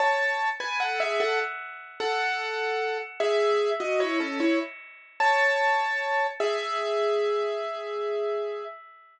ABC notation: X:1
M:4/4
L:1/16
Q:1/4=75
K:E
V:1 name="Acoustic Grand Piano"
[ca]3 [Bg] [Af] [Ge] [Af] z3 [Af]6 | [Ge]3 [Fd] [Ec] [CA] [Ec] z3 [ca]6 | [Ge]12 z4 |]